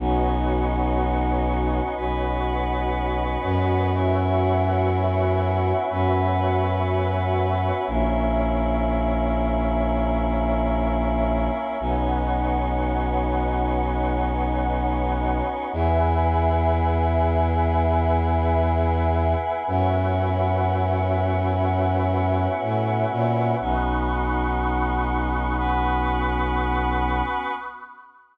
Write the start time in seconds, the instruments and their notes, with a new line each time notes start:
0.00 violin B1, choir aahs B3 C#4 D#4 F#4, pad 2 (warm) F#4 B4 C#5 D#5
1.96 violin B1, choir aahs B3 C#4 F#4 B4
3.43 violin F#2
3.93 choir aahs B3 C#4 E4 F#4, pad 2 (warm) F#4 B4 C#5 E5
5.90 violin F#2, choir aahs B3 C#4 F#4 B4
7.86 violin A#1, choir aahs A#3 C#4 E4, pad 2 (warm) A#4 C#5 E5
11.80 violin B1, choir aahs B3 C#4 D#4 F#4, pad 2 (warm) B4 C#5 D#5 F#5
15.73 violin E2, choir aahs B3 E4 G#4, pad 2 (warm) B4 E5 G#5
19.67 violin F#2, choir aahs B3 C#4 E4 F#4, pad 2 (warm) B4 C#5 E5 F#5
22.61 violin A2
23.11 violin A#2
23.60 violin B1, choir aahs B3 C#4 D#4 F#4, pad 2 (warm) B5 C#6 D#6 F#6
25.57 choir aahs B3 C#4 F#4 B4